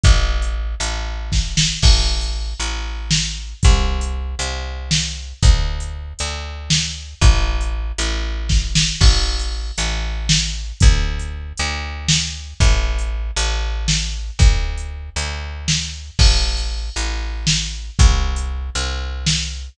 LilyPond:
<<
  \new Staff \with { instrumentName = "Electric Bass (finger)" } { \clef bass \time 7/8 \key a \dorian \tempo 4 = 117 a,,4. a,,2 | a,,4. a,,2 | c,4. c,2 | d,4. d,2 |
a,,4. a,,2 | a,,4. a,,2 | d,4. d,2 | a,,4. a,,2 |
d,4. d,2 | a,,4. a,,2 | c,4. c,2 | }
  \new DrumStaff \with { instrumentName = "Drums" } \drummode { \time 7/8 <hh bd>8. hh8. hh4 <bd sn>8 sn8 | <cymc bd>8. hh8. hh4 sn4 | <hh bd>8. hh8. hh4 sn4 | <hh bd>8. hh8. hh4 sn4 |
<hh bd>8. hh8. hh4 <bd sn>8 sn8 | <cymc bd>8. hh8. hh4 sn4 | <hh bd>8. hh8. hh4 sn4 | <hh bd>8. hh8. hh4 sn4 |
<hh bd>8. hh8. hh4 sn4 | <cymc bd>8. hh8. hh4 sn4 | <hh bd>8. hh8. hh4 sn4 | }
>>